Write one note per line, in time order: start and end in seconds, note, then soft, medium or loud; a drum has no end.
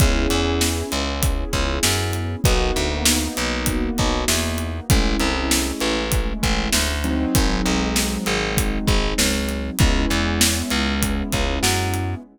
0.00 0.27 C#2 loud
0.00 2.40 B3 medium
0.00 2.40 C#4 medium
0.00 2.40 E4 medium
0.00 2.40 G#4 medium
0.00 kick loud
0.00 closed hi-hat medium
0.30 0.83 E2 loud
0.30 closed hi-hat medium
0.61 snare loud
0.92 1.44 C#2 medium
0.92 closed hi-hat medium
1.23 kick medium
1.23 closed hi-hat loud
1.53 1.79 C#2 loud
1.53 kick medium
1.53 closed hi-hat medium
1.83 2.36 F#2 loud
1.83 snare loud
2.13 closed hi-hat medium
2.44 2.71 B1 loud
2.44 4.85 A#3 medium
2.44 4.85 B3 medium
2.44 4.85 D#4 medium
2.44 4.85 F#4 medium
2.44 kick loud
2.44 closed hi-hat medium
2.76 3.28 D2 loud
2.76 closed hi-hat medium
3.05 snare loud
3.37 3.90 B1 loud
3.37 closed hi-hat medium
3.66 kick medium
3.66 closed hi-hat loud
3.98 4.25 B1 loud
3.98 kick medium
3.98 closed hi-hat medium
4.28 4.80 E2 medium
4.28 snare loud
4.58 closed hi-hat medium
4.90 5.16 A1 loud
4.90 6.93 G#3 medium
4.90 6.93 A3 medium
4.90 6.93 C#4 medium
4.90 6.93 E4 medium
4.90 kick loud
4.90 closed hi-hat loud
5.20 5.72 C2 loud
5.20 closed hi-hat medium
5.51 snare loud
5.80 6.33 A1 loud
5.80 closed hi-hat medium
6.12 kick medium
6.12 closed hi-hat loud
6.43 6.69 A1 loud
6.43 kick medium
6.43 closed hi-hat medium
6.72 7.25 D2 loud
6.72 snare loud
7.04 9.75 F#3 medium
7.04 9.75 G#3 medium
7.04 9.75 C4 medium
7.04 9.75 D#4 medium
7.04 closed hi-hat medium
7.35 7.61 G#1 loud
7.35 kick medium
7.35 closed hi-hat loud
7.66 8.18 B1 loud
7.66 closed hi-hat medium
7.96 snare loud
8.26 8.79 G#1 loud
8.26 closed hi-hat medium
8.57 kick medium
8.57 closed hi-hat loud
8.88 9.14 G#1 loud
8.88 kick medium
8.88 closed hi-hat medium
9.18 9.70 C#2 medium
9.18 snare loud
9.49 closed hi-hat medium
9.79 10.05 C#2 loud
9.79 12.20 G#3 medium
9.79 12.20 B3 medium
9.79 12.20 C#4 medium
9.79 12.20 E4 medium
9.79 kick loud
9.79 closed hi-hat medium
10.10 10.62 E2 loud
10.10 closed hi-hat medium
10.41 snare loud
10.70 11.23 C#2 loud
10.70 closed hi-hat medium
11.02 kick medium
11.02 closed hi-hat loud
11.32 11.59 C#2 medium
11.32 kick medium
11.32 closed hi-hat medium
11.63 12.15 F#2 loud
11.63 snare loud
11.94 closed hi-hat medium